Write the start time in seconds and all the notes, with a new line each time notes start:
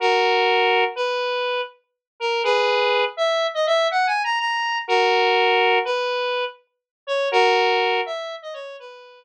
0.00 F#4 A#4
0.95 B4
2.20 A#4
2.43 G#4 B4
3.17 E5
3.54 D#5
3.66 E5
3.91 F#5
4.07 G#5
4.24 A#5
4.39 A#5
4.88 F#4 A#4
5.85 B4
7.07 C#5
7.32 F#4 A#4
8.06 E5
8.42 D#5
8.53 C#5
8.79 B4